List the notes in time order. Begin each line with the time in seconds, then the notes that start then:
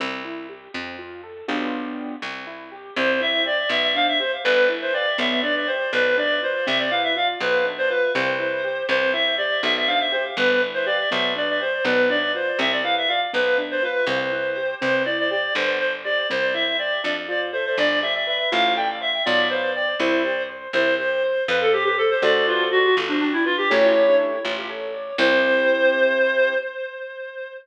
0.00 C2 C4
0.25 E4
0.49 G4
0.74 F2 C4
0.99 F4
1.23 A4
1.48 B1 B3 D4 F4 G4
2.22 C2 C4
2.47 E4
2.72 G4
2.96 C2 C4 C5
3.21 E4 E5
3.46 G4 D5
3.69 B1 B3 E5
3.83 E5
3.95 D4 F5
4.08 E5
4.20 G4 C5
4.44 G1 B3 B4
4.69 E4
4.82 C5
4.94 G4 D5
5.18 B1 B3 E5
5.43 D4 D5
5.56 D5
5.67 G4 C5
5.93 B1 B3 B4
6.17 D4 D5
6.42 F4 C5
6.66 C2 C4 E5
6.79 D5
6.90 E4 F5
7.04 E5
7.16 F4 F5
7.40 B1 B3 B4
7.65 D4
7.78 C5
7.89 F4 B4
8.15 C2 C4 C5
8.40 E4
8.64 G4
8.89 C2 C4 C5
9.13 E4 E5
9.38 G4 D5
9.63 B1 B3 E5
9.76 E5
9.87 D4 F5
10.00 E5
10.12 G4 C5
10.37 G1 B3 B4
10.62 E4
10.74 C5
10.86 G4 D5
11.11 B1 B3 E5
11.36 D4 D5
11.49 D5
11.60 G4 C5
11.85 B1 B3 B4
12.09 D4 D5
12.34 F4 C5
12.59 C2 C4 E5
12.72 D5
12.83 E4 F5
12.97 E5
13.08 F4 F5
13.33 B1 B3 B4
13.58 D4
13.71 C5
13.83 F4 B4
14.07 C2 C4 C5
14.32 E4
14.57 G4
14.81 C2 C4 C5
15.05 E4 D5
15.19 D5
15.30 G4 D5
15.55 G1 B3 C5
15.80 D4 C5
16.04 G4 D5
16.30 C2 C4 C5
16.54 E4 E5
16.79 G4 D5
17.03 F2 D4 D5
17.28 F4 D5
17.52 A4 C5
17.66 C5
17.78 G1 D4 D5
18.02 G4 E5
18.14 E5
18.27 B4 E5
18.52 A1 F4 F5
18.76 A4 G5
19.01 C5 E5
19.25 B1 F4 D5
19.50 B4 C5
19.75 D5
20.00 C2 E4 C5
20.25 G4
20.49 C5
20.73 C2 E4 C5
20.99 G4 C5
21.23 C5
21.48 F2 F4 B4
21.61 A4
21.73 G4 A4
21.84 G4
21.98 A4 C5
22.11 C5
22.22 D2 F#4 A4 C5 D5
22.47 F4
22.71 F#4
22.96 G1 F4
23.08 D4
23.20 D4 G4
23.33 E4
23.45 F4 B4
23.58 G4
23.70 A1 E4 G4 A4 C#5
24.44 A1 F4
24.69 A4
24.94 D5
25.18 C2 C4 E4 G4 C5